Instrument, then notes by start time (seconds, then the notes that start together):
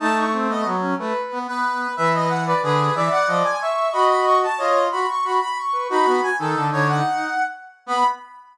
brass section
0.00 A3 D#4 A5
0.17 C#6
0.32 C4
0.49 B3 D#5
0.65 F#3
0.81 C#4
0.99 A3 B4
1.32 B3
1.47 B3 B4
1.97 E3 B4 E5
2.14 D#5
2.29 F#5
2.46 B4 D5
2.63 D3 G#4 B4
2.95 E3 D5 E5
3.11 F#5
3.27 F3 D#5
3.44 G#5
3.61 E5 C#6
3.92 F#4 D#5 B5
4.09 B5
4.25 C#6
4.43 A5
4.58 F4 C#5 D#5
4.91 F#4 B5
5.09 C#6
5.25 F#4 B5
5.41 B5
5.58 C#6
5.73 B4
5.90 D#4 F#4 B5
6.06 B3
6.23 G#5
6.39 D#3 D#4 A4
6.56 D3
6.71 D3 C#5
6.88 F#5
7.86 B3 B5